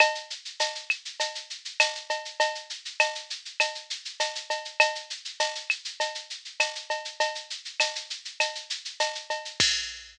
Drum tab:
CC |----------------|----------------|----------------|----------------|
TB |----x-------x---|----x-------x---|----x-------x---|----x-------x---|
SH |xxxxxxxxxxxxxxxx|xxxxxxxxxxxxxxxx|xxxxxxxxxxxxxxxx|xxxxxxxxxxxxxxxx|
CB |x---x---x---x-x-|x---x---x---x-x-|x---x---x---x-x-|x---x---x---x-x-|
CL |x-----x-----x---|----x---x-------|x-----x-----x---|----x---x-------|
BD |----------------|----------------|----------------|----------------|

CC |x---------------|
TB |----------------|
SH |----------------|
CB |----------------|
CL |----------------|
BD |o---------------|